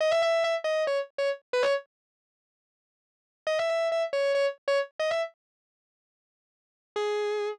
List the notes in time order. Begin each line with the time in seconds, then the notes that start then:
0.00 D#5
0.11 E5
0.22 E5
0.44 E5
0.64 D#5
0.87 C#5
1.18 C#5
1.53 B4
1.63 C#5
3.47 D#5
3.59 E5
3.70 E5
3.92 E5
4.13 C#5
4.35 C#5
4.68 C#5
4.99 D#5
5.11 E5
6.96 G#4